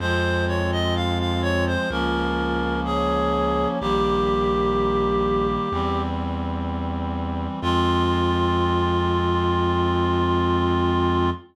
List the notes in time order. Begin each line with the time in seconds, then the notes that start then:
0.00 F2 F3 G#3 C4 F4 C5
0.48 C#5
0.72 D#5
0.95 F5
1.19 F5
1.42 C#5
1.67 C5
1.90 C#2 F3 A#3 C#4 F4 A#4
2.85 G#4 C#5
3.81 A#1 D#3 G3 A#3 G4
5.72 E2 E3 G3 C4
7.62 F2 F3 G#3 C4 F4